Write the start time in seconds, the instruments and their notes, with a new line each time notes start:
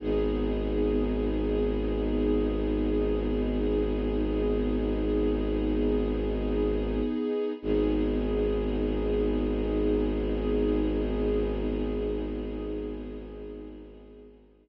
0.00 violin G#1, string ensemble 1 B3 D#4 G#4
7.61 violin G#1, string ensemble 1 B3 D#4 G#4